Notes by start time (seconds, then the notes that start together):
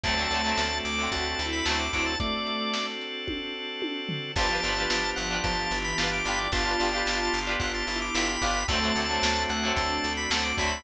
0.03 D2 D3 F#3 A3 C4 D4 F#4 A4 C5 D5 F#5 A5, kick, closed hi-hat
0.09 C4
0.17 D3 F#3 A3
0.22 C4
0.30 D2 D3 F#3 A3, closed hi-hat
0.36 C4
0.44 D3 F#3 A3
0.49 C4
0.57 D2 A3, snare
0.85 D2 D6, closed hi-hat
0.98 D3 F#3 A3
1.03 C4
1.12 D2 F#4 A5, kick, closed hi-hat
1.39 D2 E4, closed hi-hat
1.53 B5
1.65 D2 D3 F#3 A3 A5, snare
1.71 C4
1.79 D6
1.93 D2 D3 F#3 A3 D6, kick, closed hi-hat
1.98 C4
2.06 A5
2.20 A3 C4 D4 F#4 A4 C5 D5 F#5 A5, kick, closed hi-hat
2.47 closed hi-hat
2.74 snare
3.01 closed hi-hat
3.27 kick, high tom
3.82 high tom
4.09 floor tom
4.36 G1 F3 B3 D4 F4 G4 A5, kick, crash
4.41 B4
4.50 D4 F4 G4
4.55 B4
4.63 G1 D4 F4 G4, closed hi-hat
4.68 B4
4.77 D4 F4 G4
4.82 B4
4.90 G1 F3, snare
5.16 G1 F#5, closed hi-hat
5.31 D4 F4 G4
5.36 B4
5.44 G1 F3 A5, kick, closed hi-hat
5.71 G1 E3, closed hi-hat
5.84 B5
5.98 G1 D4 F4 G4 A5, snare
6.03 B4
6.13 D6
6.25 G1 D4 F4 G4 B5, closed hi-hat
6.30 B4
6.38 D5
6.52 G1 B3 D4 F4 G4 A5, kick, closed hi-hat
6.57 B4
6.66 D4 F4 G4
6.71 B4
6.79 G1 D4 F4 G4, closed hi-hat
6.84 B4
6.93 D4 F4 G4
6.98 B4
7.06 G1, snare
7.33 G1, closed hi-hat
7.47 D4 F4 G4
7.52 B4
7.60 G1 F4 F#5, kick, closed hi-hat
7.74 A5
7.87 G1 E4 A5, closed hi-hat
8.02 D6
8.15 G1 D4 F4 G4 B5, snare
8.19 B4
8.29 B5
8.42 G1 D4 F4 G4, kick, closed hi-hat
8.46 B4
8.68 D2 D3 F#3 A3 C4 D4 F#4 A4 A5, kick, closed hi-hat
8.73 C4
8.82 D3 F#3 A3
8.87 C4
8.96 D2 D3 F#3 A3, closed hi-hat
9.00 C4
9.09 D3 F#3 A3
9.14 C4
9.23 D2, snare
9.49 D2 F#5, closed hi-hat
9.63 D3 F#3 A3
9.68 C4
9.76 D2 D4 A5, kick, closed hi-hat
10.04 D2, closed hi-hat
10.17 B5
10.30 D2 D3 F#3 A3 A5, snare
10.36 C4
10.43 D6
10.57 D2 D3 F#3 A3 B5, kick, open hi-hat
10.63 C4
10.72 B5